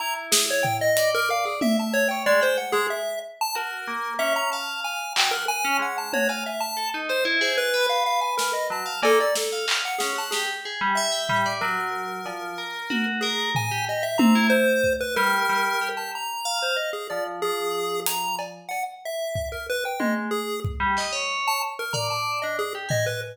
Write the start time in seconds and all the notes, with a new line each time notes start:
0.00 E4 A#5
0.32 G#4, snare
0.50 C#5
0.63 G5, floor tom
0.81 D#5
0.97 D5, closed hi-hat
1.15 A#4
1.30 F5
1.45 G#4
1.61 E5, high tom
1.79 A5
1.94 C#5
2.08 C#5 G5
2.26 G#3 D5
2.41 C5 G5
2.58 F#5
2.72 G#3 G#4
2.90 E5
3.41 A5
3.55 F#4 A#4
3.87 A#3
4.19 C#4 E5
4.36 A#5
4.52 F5 A5
4.84 G#5
5.16 F#3 G5, clap
5.31 A#4 F#5
5.48 G#5
5.65 C#4
5.79 G#3 F#5
5.98 A5
6.13 F#4 C#5, high tom
6.29 F5 G#5
6.46 E5
6.60 A5
6.77 A4
6.94 D#4
7.09 C5
7.25 E4
7.41 G#4 C5
7.58 B4
7.74 B4
7.89 F5
8.06 F5
8.21 G#5
8.37 A#4, snare
8.53 D#5
8.70 F#3 A5
8.86 F5
9.03 A#3 A4, cowbell
9.20 D5
9.35 A4, snare
9.52 F5
9.68 clap
9.85 F#5
9.99 C#4 G#4, snare
10.16 F#5 A5
10.31 G4 G#4, snare
10.65 G#4
10.81 G3
10.95 E5
11.12 G5
11.29 G3, floor tom
11.46 D5
11.61 F#3 A#4
12.26 F3, cowbell
12.58 A#4
12.90 F#4, high tom
13.21 G#4 A#4
13.55 G#5, floor tom
13.71 G4
13.88 G4 D#5
14.03 E5
14.18 C4 A#5, high tom
14.35 E4
14.50 C5
14.84 kick
15.01 B4
15.16 G3 A#4
15.49 G3
15.81 G4
15.97 A5
16.15 A#5
16.45 F5
16.62 C5
16.76 D#5
16.93 G#4
17.10 F3 D5
17.42 F3 G#4
18.06 A#5, closed hi-hat
18.39 cowbell
18.69 F#5, cowbell
19.05 E5
19.35 kick
19.52 A#4
19.69 B4
19.85 G5
19.99 G#3 D#5, high tom
20.31 G#4
20.65 kick
20.80 G3
20.97 D#5, clap
21.12 C#5
21.48 A5
21.79 A#4
21.93 D5 A#5, floor tom
22.10 A5
22.42 D4 D#5
22.59 G#4
22.75 G4
22.89 D#5 G#5, floor tom
23.06 B4